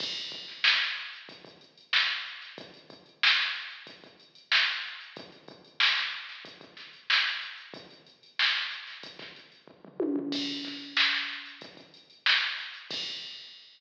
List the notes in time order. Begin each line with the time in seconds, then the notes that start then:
0.00 kick, crash
0.16 closed hi-hat
0.32 kick, closed hi-hat
0.48 snare, closed hi-hat
0.64 snare
0.80 snare, closed hi-hat
0.97 closed hi-hat
1.13 closed hi-hat
1.29 kick, closed hi-hat
1.45 kick, closed hi-hat
1.61 closed hi-hat
1.78 closed hi-hat
1.93 snare
2.10 closed hi-hat
2.26 closed hi-hat
2.42 snare, closed hi-hat
2.58 kick, closed hi-hat
2.74 closed hi-hat
2.90 kick, closed hi-hat
3.06 closed hi-hat
3.23 snare
3.38 snare, closed hi-hat
3.55 closed hi-hat
3.71 closed hi-hat
3.87 kick, closed hi-hat
4.03 kick, closed hi-hat
4.20 closed hi-hat
4.35 closed hi-hat
4.52 snare
4.68 closed hi-hat
4.84 closed hi-hat
5.01 closed hi-hat
5.16 kick, closed hi-hat
5.32 closed hi-hat
5.48 kick, closed hi-hat
5.65 closed hi-hat
5.80 snare
5.97 snare, closed hi-hat
6.13 closed hi-hat
6.29 snare, closed hi-hat
6.45 kick, closed hi-hat
6.61 kick, closed hi-hat
6.77 snare, closed hi-hat
6.93 closed hi-hat
7.10 snare
7.26 closed hi-hat
7.42 closed hi-hat
7.58 closed hi-hat
7.74 kick, closed hi-hat
7.90 closed hi-hat
8.06 closed hi-hat
8.23 closed hi-hat
8.39 snare
8.55 snare, closed hi-hat
8.71 closed hi-hat
8.87 snare, closed hi-hat
9.03 kick, closed hi-hat
9.19 kick, snare, closed hi-hat
9.36 closed hi-hat
9.52 closed hi-hat
9.68 kick
9.85 floor tom
10.00 high tom
10.16 floor tom
10.32 kick, crash
10.48 closed hi-hat
10.64 kick, snare, closed hi-hat
10.81 closed hi-hat
10.97 snare
11.12 snare, closed hi-hat
11.29 snare, closed hi-hat
11.46 closed hi-hat
11.61 kick, closed hi-hat
11.77 kick, closed hi-hat
11.94 closed hi-hat
12.10 closed hi-hat
12.26 snare
12.42 snare, closed hi-hat
12.58 snare, closed hi-hat
12.74 closed hi-hat
12.91 kick, crash